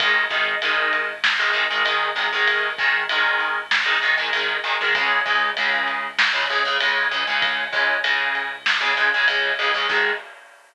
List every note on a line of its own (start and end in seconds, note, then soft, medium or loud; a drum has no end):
0.00 4.57 G#1 medium
0.00 0.24 D#3 loud
0.00 0.24 G#3 loud
0.00 kick loud
0.00 ride loud
0.30 0.55 D#3 medium
0.30 0.55 G#3 medium
0.30 kick medium
0.30 ride medium
0.62 1.12 D#3 medium
0.62 1.12 G#3 medium
0.62 ride loud
0.93 ride medium
1.24 snare loud
1.39 1.52 D#3 medium
1.39 1.52 G#3 medium
1.53 1.65 D#3 medium
1.53 1.65 G#3 medium
1.53 ride medium
1.70 1.83 D#3 medium
1.70 1.83 G#3 medium
1.85 2.10 D#3 medium
1.85 2.10 G#3 medium
1.85 ride loud
2.16 2.28 D#3 medium
2.16 2.28 G#3 medium
2.16 ride medium
2.33 2.70 D#3 medium
2.33 2.70 G#3 loud
2.47 ride loud
2.78 3.04 D#3 loud
2.78 3.04 G#3 medium
2.78 kick loud
2.78 ride medium
3.09 3.60 D#3 loud
3.09 3.60 G#3 medium
3.09 ride loud
3.40 ride medium
3.71 snare loud
3.86 3.98 D#3 medium
3.86 3.98 G#3 medium
4.02 4.15 D#3 medium
4.02 4.15 G#3 medium
4.02 ride medium
4.18 4.30 D#3 medium
4.18 4.30 G#3 medium
4.33 4.57 D#3 medium
4.33 4.57 G#3 loud
4.33 ride loud
4.64 4.76 D#3 loud
4.64 4.76 G#3 medium
4.64 ride medium
4.81 4.93 D#3 medium
4.81 4.93 G#3 medium
4.95 9.51 C#2 medium
4.95 5.20 C#3 loud
4.95 5.20 G#3 loud
4.95 kick loud
4.95 ride loud
5.26 5.50 C#3 medium
5.26 5.50 G#3 medium
5.26 kick medium
5.26 ride medium
5.57 6.07 C#3 medium
5.57 6.07 G#3 medium
5.57 ride loud
5.88 ride medium
6.19 snare loud
6.33 6.45 C#3 loud
6.33 6.45 G#3 medium
6.49 6.63 C#3 medium
6.49 6.63 G#3 medium
6.49 ride medium
6.65 6.77 C#3 medium
6.65 6.77 G#3 medium
6.80 7.06 C#3 medium
6.80 7.06 G#3 medium
6.80 ride loud
7.11 7.24 C#3 loud
7.11 7.24 G#3 medium
7.11 ride medium
7.27 7.64 C#3 medium
7.27 7.64 G#3 medium
7.42 kick loud
7.42 ride loud
7.73 7.97 C#3 medium
7.73 7.97 G#3 medium
7.73 kick loud
7.73 ride medium
8.04 8.53 C#3 medium
8.04 8.53 G#3 medium
8.04 ride loud
8.35 ride medium
8.66 snare loud
8.81 8.93 C#3 loud
8.81 8.93 G#3 medium
8.97 9.09 C#3 medium
8.97 9.09 G#3 loud
8.97 ride medium
9.14 9.26 C#3 loud
9.14 9.26 G#3 medium
9.27 9.52 C#3 medium
9.27 9.52 G#3 medium
9.27 ride loud
9.59 9.71 C#3 medium
9.59 9.71 G#3 loud
9.59 ride medium
9.74 9.87 C#3 medium
9.74 9.87 G#3 medium
9.89 10.12 G#2 loud
9.89 10.11 D#3 medium
9.89 10.11 G#3 loud
9.89 kick loud
9.89 crash loud